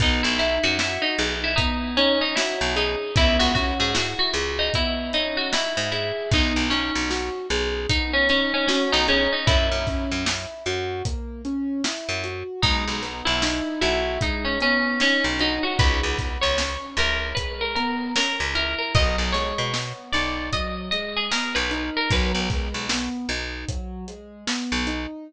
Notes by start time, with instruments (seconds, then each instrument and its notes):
0.00 electric bass (finger) B1, acoustic grand piano B3, pizzicato strings D#4, kick, closed hi-hat
0.23 electric bass (finger) B1, pizzicato strings E4
0.39 acoustic grand piano D#4, pizzicato strings E4, snare, closed hi-hat
0.63 electric bass (finger) F#2, pizzicato strings F#4
0.79 pizzicato strings E4, acoustic grand piano F#4, snare
1.02 pizzicato strings D#4
1.18 electric bass (finger) B1, acoustic grand piano G#4, closed hi-hat
1.44 pizzicato strings E4
1.56 acoustic grand piano B3, pizzicato strings D#4, kick, closed hi-hat
1.97 pizzicato strings C#4, acoustic grand piano D#4, closed hi-hat
2.21 pizzicato strings D#4
2.36 pizzicato strings E4, acoustic grand piano F#4, snare
2.61 electric bass (finger) B1
2.76 pizzicato strings D#4, acoustic grand piano G#4, closed hi-hat
3.16 electric bass (finger) C#2, acoustic grand piano B3, pizzicato strings E4, kick, closed hi-hat
3.39 electric bass (finger) C#2, pizzicato strings F#4
3.55 acoustic grand piano C#4, pizzicato strings F#4, kick, snare, closed hi-hat
3.80 electric bass (finger) G#2, pizzicato strings G#4
3.95 acoustic grand piano E4, pizzicato strings F#4, snare
4.19 pizzicato strings F#4
4.34 electric bass (finger) C#2, acoustic grand piano G#4, closed hi-hat
4.59 pizzicato strings D#4
4.74 acoustic grand piano B3, pizzicato strings E4, kick, closed hi-hat
5.13 acoustic grand piano C#4, pizzicato strings D#4, closed hi-hat
5.37 pizzicato strings F#4
5.53 acoustic grand piano E4, pizzicato strings E4, snare
5.77 electric bass (finger) G#2
5.92 pizzicato strings E4, acoustic grand piano G#4, closed hi-hat
6.31 electric bass (finger) B1, acoustic grand piano B3, pizzicato strings D#4, kick, closed hi-hat
6.56 electric bass (finger) B1
6.70 pizzicato strings C#4, acoustic grand piano D#4, snare, closed hi-hat
6.95 electric bass (finger) B1
7.10 acoustic grand piano F#4, snare
7.50 electric bass (finger) B1, acoustic grand piano G#4, closed hi-hat
7.89 acoustic grand piano B3, pizzicato strings D#4, kick, closed hi-hat
8.13 pizzicato strings C#4
8.29 pizzicato strings C#4, acoustic grand piano D#4, snare, closed hi-hat
8.54 pizzicato strings C#4
8.67 pizzicato strings C#4, acoustic grand piano F#4, snare
8.92 electric bass (finger) B1, pizzicato strings D#4
9.08 pizzicato strings C#4, acoustic grand piano G#4, closed hi-hat
9.32 pizzicato strings D#4
9.47 electric bass (finger) F#2, acoustic grand piano A#3, pizzicato strings E4, kick, closed hi-hat
9.72 electric bass (finger) F#2
9.87 acoustic grand piano C#4, kick, snare, closed hi-hat
10.12 electric bass (finger) F#2
10.26 acoustic grand piano E4, snare
10.66 electric bass (finger) F#2, acoustic grand piano F#4, closed hi-hat
11.05 acoustic grand piano A#3, kick, closed hi-hat
11.45 acoustic grand piano C#4, closed hi-hat
11.84 acoustic grand piano E4, snare
12.09 electric bass (finger) F#2
12.24 acoustic grand piano F#4, closed hi-hat
12.62 electric bass (finger) B1, acoustic grand piano G#3, pizzicato strings D#4, kick, closed hi-hat
12.88 electric bass (finger) B1
13.02 acoustic grand piano B3, snare, closed hi-hat
13.25 electric bass (finger) B1, pizzicato strings E4
13.42 acoustic grand piano D#4, snare
13.81 electric bass (finger) B1, pizzicato strings E4, acoustic grand piano F#4, closed hi-hat
14.21 acoustic grand piano G#3, pizzicato strings D#4, kick, closed hi-hat
14.45 pizzicato strings C#4
14.60 acoustic grand piano B3, pizzicato strings C#4, closed hi-hat
15.00 pizzicato strings C#4, acoustic grand piano D#4, snare
15.24 electric bass (finger) B1
15.39 pizzicato strings D#4, acoustic grand piano F#4, closed hi-hat
15.63 pizzicato strings F#4
15.79 electric bass (finger) C#2, acoustic grand piano G#3, pizzicato strings B4, kick, closed hi-hat
16.03 electric bass (finger) C#2
16.18 acoustic grand piano B3, kick, snare, closed hi-hat
16.41 electric bass (finger) C#2, pizzicato strings C#5
16.58 acoustic grand piano C#4, snare
16.97 electric bass (finger) C#2, acoustic grand piano E4, pizzicato strings A#4, closed hi-hat
17.35 acoustic grand piano G#3, pizzicato strings B4, kick, closed hi-hat
17.61 pizzicato strings A#4
17.75 acoustic grand piano B3, pizzicato strings A#4, closed hi-hat
18.16 acoustic grand piano C#4, pizzicato strings A#4, snare
18.40 electric bass (finger) C#2
18.55 acoustic grand piano E4, pizzicato strings A#4, closed hi-hat
18.78 pizzicato strings A#4
18.95 electric bass (finger) B1, acoustic grand piano F#3, pizzicato strings D#5, kick, closed hi-hat
19.18 electric bass (finger) B1
19.32 acoustic grand piano G#3, pizzicato strings C#5, snare, closed hi-hat
19.58 electric bass (finger) B2
19.74 acoustic grand piano B3, snare
20.13 electric bass (finger) B1, acoustic grand piano D#4, pizzicato strings D5, snare, closed hi-hat
20.52 acoustic grand piano F#3, pizzicato strings D#5, kick, closed hi-hat
20.91 acoustic grand piano G#3, pizzicato strings D#5, closed hi-hat
21.16 pizzicato strings G#4
21.31 acoustic grand piano B3, pizzicato strings A#4, snare
21.55 electric bass (finger) B1, pizzicato strings B4
21.71 acoustic grand piano D#4, closed hi-hat
21.97 pizzicato strings A#4
22.11 electric bass (finger) B1, acoustic grand piano F#3, pizzicato strings B4, kick, closed hi-hat
22.35 electric bass (finger) B1
22.50 acoustic grand piano G#3, kick, snare, closed hi-hat
22.74 electric bass (finger) B1
22.89 acoustic grand piano B3, snare
23.29 electric bass (finger) B1, acoustic grand piano D#4, closed hi-hat
23.68 acoustic grand piano F#3, kick, closed hi-hat
24.08 acoustic grand piano G#3, closed hi-hat
24.47 acoustic grand piano B3, snare
24.72 electric bass (finger) B1
24.87 acoustic grand piano D#4, closed hi-hat